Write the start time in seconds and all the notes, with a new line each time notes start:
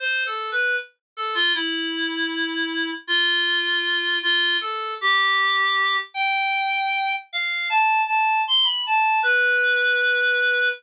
0.00 C5
0.26 A4
0.52 B4
1.17 A4
1.34 F4
1.55 E4
3.07 F4
4.23 F4
4.61 A4
5.01 G4
6.14 G5
7.33 F5
7.70 A5
8.07 A5
8.47 C6
8.64 B5
8.86 A5
9.23 B4